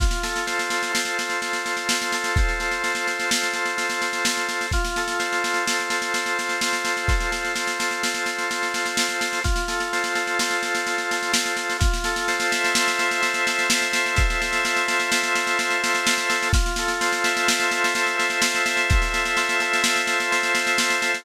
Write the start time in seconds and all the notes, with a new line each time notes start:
0.00 F4, kick, snare
0.11 snare
0.23 A4, snare
0.36 snare
0.47 C5, snare
0.59 snare
0.70 A4, snare
0.83 snare
0.93 F4, snare
1.05 snare
1.19 A4, snare
1.30 snare
1.41 C5, snare
1.53 snare
1.65 A4, snare
1.77 snare
1.89 F4, snare
2.02 snare
2.12 A4, snare
2.24 snare
2.36 C5, kick, snare
2.49 snare
2.60 A4, snare
2.71 snare
2.84 F4, snare
2.95 snare
3.07 A4, snare
3.19 snare
3.31 C5, snare
3.43 snare
3.53 A4, snare
3.65 snare
3.77 F4, snare
3.90 snare
4.02 A4, snare
4.13 snare
4.25 C5, snare
4.37 snare
4.49 A4, snare
4.61 snare
4.71 F4, kick, snare
4.85 snare
4.96 A4, snare
5.08 snare
5.19 C5, snare
5.32 snare
5.44 A4, snare
5.54 snare
5.66 F4, snare
5.80 snare
5.90 A4, snare
6.02 snare
6.14 C5, snare
6.26 snare
6.39 A4, snare
6.49 snare
6.61 F4, snare
6.73 snare
6.85 A4, snare
6.97 snare
7.08 C5, kick, snare
7.20 snare
7.31 A4, snare
7.45 snare
7.55 F4, snare
7.67 snare
7.79 A4, snare
7.91 snare
8.03 C5, snare
8.14 snare
8.26 A4, snare
8.38 snare
8.50 F4, snare
8.63 snare
8.74 A4, snare
8.86 snare
8.97 C5, snare
9.09 snare
9.19 A4, snare
9.33 snare
9.44 F4, kick, snare
9.56 snare
9.68 A4, snare
9.80 snare
9.93 C5, snare
10.04 snare
10.15 A4, snare
10.27 snare
10.39 F4, snare
10.51 snare
10.63 A4, snare
10.75 snare
10.87 C5, snare
10.98 snare
11.11 A4, snare
11.23 snare
11.33 F4, snare
11.46 snare
11.57 A4, snare
11.70 snare
11.79 F4, kick, snare
11.94 snare
12.04 A4, snare
12.16 snare
12.28 C5, snare
12.40 snare
12.51 E5, snare
12.64 snare
12.75 C5, snare
12.88 snare
12.99 A4, snare
13.11 snare
13.22 F4, snare
13.34 snare
13.47 A4, snare
13.59 snare
13.70 C5, snare
13.82 snare
13.92 E5, snare
14.06 snare
14.16 C5, kick, snare
14.30 snare
14.40 A4, snare
14.53 snare
14.65 F4, snare
14.76 snare
14.87 A4, snare
15.00 snare
15.11 C5, snare
15.23 snare
15.35 E5, snare
15.47 snare
15.59 C5, snare
15.70 snare
15.83 A4, snare
15.95 snare
16.07 F4, snare
16.18 snare
16.29 A4, snare
16.43 snare
16.53 F4, kick, snare
16.66 snare
16.76 A4, snare
16.88 snare
17.01 C5, snare
17.13 snare
17.24 E5, snare
17.37 snare
17.48 C5, snare
17.60 snare
17.71 A4, snare
17.84 snare
17.95 F4, snare
18.06 snare
18.17 A4, snare
18.30 snare
18.42 C5, snare
18.55 snare
18.66 E5, snare
18.77 snare
18.90 C5, kick, snare
19.02 snare
19.12 A4, snare
19.25 snare
19.37 F4, snare
19.49 snare
19.60 A4, snare
19.73 snare
19.83 C5, snare
19.96 snare
20.07 E5, snare
20.20 snare
20.32 C5, snare
20.43 snare
20.54 A4, snare
20.67 snare
20.78 F4, snare
20.90 snare
21.02 A4, snare
21.14 snare